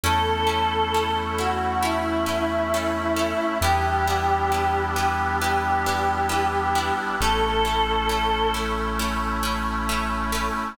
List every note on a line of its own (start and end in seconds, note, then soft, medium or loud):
0.04 3.33 E2 medium
0.04 3.58 A3 medium
0.04 3.58 C#4 medium
0.04 0.22 C#4 loud
0.04 3.58 E4 medium
0.04 0.22 E4 medium
0.04 1.12 A4 medium
0.04 0.22 A4 loud
0.47 0.65 C#4 medium
0.47 0.65 E4 medium
0.47 0.65 A4 medium
0.94 1.12 C#4 medium
0.94 1.12 E4 medium
0.94 1.12 A4 medium
1.38 1.56 C#4 medium
1.38 1.56 E4 medium
1.38 1.79 F#4 medium
1.38 1.56 A4 medium
1.82 2.00 C#4 medium
1.82 2.00 E4 loud
1.82 3.54 E4 medium
1.82 2.00 A4 medium
2.26 2.44 C#4 medium
2.26 2.44 E4 medium
2.26 2.44 A4 medium
2.74 2.92 C#4 medium
2.74 2.92 E4 medium
2.74 2.92 A4 medium
3.16 3.34 C#4 medium
3.16 3.34 E4 medium
3.16 3.34 A4 medium
3.61 6.91 E2 medium
3.61 7.16 G3 medium
3.61 7.16 B3 medium
3.61 3.80 B3 loud
3.61 7.16 D4 medium
3.61 3.80 D4 medium
3.61 7.16 E4 medium
3.61 3.80 E4 medium
3.61 4.81 G4 loud
3.61 3.80 G4 loud
4.07 4.25 B3 medium
4.07 4.25 D4 medium
4.07 4.25 E4 medium
4.07 4.25 G4 medium
4.52 4.70 B3 medium
4.52 4.70 D4 medium
4.52 4.70 E4 medium
4.52 4.70 G4 medium
4.96 5.14 B3 medium
4.96 5.14 D4 medium
4.96 5.14 E4 medium
4.96 5.14 G4 medium
4.96 5.32 G4 medium
5.41 5.60 B3 medium
5.41 5.60 D4 medium
5.41 5.60 E4 medium
5.41 6.96 G4 medium
5.41 5.60 G4 medium
5.86 6.04 B3 loud
5.86 6.04 D4 medium
5.86 6.04 E4 medium
5.86 6.04 G4 medium
6.29 6.47 B3 medium
6.29 6.47 D4 medium
6.29 6.47 E4 medium
6.29 6.47 G4 loud
6.75 6.93 B3 medium
6.75 6.93 D4 medium
6.75 6.93 E4 loud
6.75 6.93 G4 medium
7.20 10.50 A1 medium
7.20 10.74 A3 medium
7.20 7.40 A3 loud
7.20 10.74 C#4 medium
7.20 7.40 C#4 loud
7.20 10.74 E4 medium
7.20 7.40 E4 loud
7.20 8.49 A4 medium
7.65 7.83 A3 medium
7.65 7.83 C#4 medium
7.65 7.83 E4 medium
8.09 8.27 A3 medium
8.09 8.27 C#4 medium
8.09 8.27 E4 medium
8.54 8.72 A3 medium
8.54 8.72 C#4 medium
8.54 8.72 E4 medium
8.99 9.17 A3 medium
8.99 9.17 C#4 medium
8.99 9.17 E4 medium
9.43 9.61 A3 medium
9.43 9.61 C#4 medium
9.43 9.61 E4 medium
9.89 10.07 A3 medium
9.89 10.07 C#4 medium
9.89 10.07 E4 medium
10.32 10.50 A3 medium
10.32 10.50 C#4 medium
10.32 10.50 E4 medium